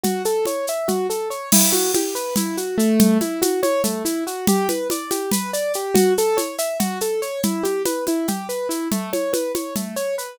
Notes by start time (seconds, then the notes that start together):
0.03 F#4, low conga, shaker
0.25 A4, shaker
0.45 C#5, high conga, shaker
0.67 E5, shaker
0.88 F#4, low conga, shaker
1.10 A4, shaker
1.30 C#5, shaker
1.52 E4, crash, low conga, shaker
1.72 F#4, high conga, shaker
1.94 G4, high conga, shaker
2.15 B4, shaker
2.36 E4, low conga, shaker
2.57 F#4, shaker
2.78 A3, shaker
2.99 low conga, shaker
3.21 E4, high conga, shaker
3.42 F#4, high conga, shaker
3.63 C#5, high conga, shaker
3.84 A3, low conga, shaker
4.05 E4, shaker
4.27 F#4, shaker
4.47 G4, low conga, shaker
4.69 B4, high conga, shaker
4.90 D5, high conga, shaker
5.11 G4, high conga, shaker
5.31 B4, low conga, shaker
5.53 D5, shaker
5.74 G4, shaker
5.94 F#4, low conga, shaker
6.18 A4, shaker
6.37 C#5, high conga, shaker
6.58 E5, shaker
6.80 F#4, low conga, shaker
7.01 A4, shaker
7.22 C#5, shaker
7.43 E4, low conga, shaker
7.63 G4, high conga, shaker
7.85 B4, high conga, shaker
8.07 E4, high conga, shaker
8.28 G4, low conga, shaker
8.49 B4, shaker
8.69 E4, shaker
8.91 A3, low conga, shaker
9.13 C#5, high conga, shaker
9.33 B4, high conga, shaker
9.55 C#5, high conga, shaker
9.76 A3, low conga, shaker
9.96 C#5, shaker
10.18 B4, shaker